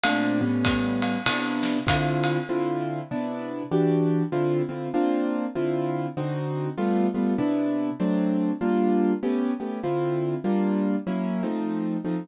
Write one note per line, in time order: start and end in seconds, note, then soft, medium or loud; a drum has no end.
0.03 0.39 A#2 medium
0.03 0.39 A3 medium
0.03 0.39 C4 medium
0.03 0.39 D4 medium
0.03 ride medium
0.41 1.17 A2 medium
0.41 1.17 G3 medium
0.41 1.17 B3 medium
0.41 1.17 C#4 medium
0.65 kick medium
0.65 hi-hat pedal medium
0.65 ride medium
1.02 ride medium
1.26 1.78 C3 medium
1.26 1.78 B3 medium
1.26 1.78 D4 medium
1.26 1.78 E4 medium
1.26 ride medium
1.63 snare soft
1.87 2.38 D3 medium
1.87 2.38 C4 medium
1.87 2.38 E4 medium
1.87 2.38 F4 medium
1.87 kick medium
1.87 hi-hat pedal medium
1.87 ride medium
2.24 ride medium
2.49 3.00 D3 medium
2.49 3.00 C4 medium
2.49 3.00 E4 medium
2.49 3.00 F4 medium
3.11 3.63 C3 medium
3.11 3.63 B3 medium
3.11 3.63 D4 medium
3.11 3.63 E4 medium
3.71 4.23 E3 medium
3.71 4.23 D4 medium
3.71 4.23 F#4 medium
3.71 4.23 G4 medium
4.32 4.62 D3 medium
4.32 4.62 C4 medium
4.32 4.62 E4 medium
4.32 4.62 F4 medium
4.69 4.88 D3 medium
4.69 4.88 C4 medium
4.69 4.88 E4 medium
4.69 4.88 F4 medium
4.94 5.45 A#3 medium
4.94 5.45 C4 medium
4.94 5.45 D4 medium
4.94 5.45 F4 medium
5.55 6.07 D3 medium
5.55 6.07 C4 medium
5.55 6.07 E4 medium
5.55 6.07 F4 medium
6.17 6.68 D3 medium
6.17 6.68 C4 medium
6.17 6.68 D#4 medium
6.17 6.68 F#4 medium
6.77 7.07 G3 medium
6.77 7.07 A3 medium
6.77 7.07 B3 medium
6.77 7.07 F4 medium
7.14 7.34 G3 medium
7.14 7.34 A3 medium
7.14 7.34 B3 medium
7.14 7.34 F4 medium
7.38 7.90 C3 medium
7.38 7.90 B3 medium
7.38 7.90 D4 medium
7.38 7.90 E4 medium
8.00 8.51 F#3 medium
8.00 8.51 A3 medium
8.00 8.51 C4 medium
8.00 8.51 D4 medium
8.61 9.12 G3 medium
8.61 9.12 A#3 medium
8.61 9.12 D4 medium
8.61 9.12 F4 medium
9.23 9.52 A3 medium
9.23 9.52 B3 medium
9.23 9.52 C#4 medium
9.23 9.52 G4 medium
9.60 9.79 A3 medium
9.60 9.79 B3 medium
9.60 9.79 C#4 medium
9.60 9.79 G4 medium
9.83 10.35 D3 medium
9.83 10.35 C4 medium
9.83 10.35 E4 medium
9.83 10.35 F4 medium
10.44 10.96 G3 medium
10.44 10.96 A#3 medium
10.44 10.96 D4 medium
10.44 10.96 F4 medium
11.07 11.42 F#3 medium
11.07 11.42 A#3 medium
11.07 11.42 C#4 medium
11.07 11.42 E4 medium
11.43 11.97 F3 medium
11.43 11.97 A3 medium
11.43 11.97 C4 medium
11.43 11.97 D#4 medium
12.04 12.24 F3 medium
12.04 12.24 A3 medium
12.04 12.24 C4 medium
12.04 12.24 D#4 medium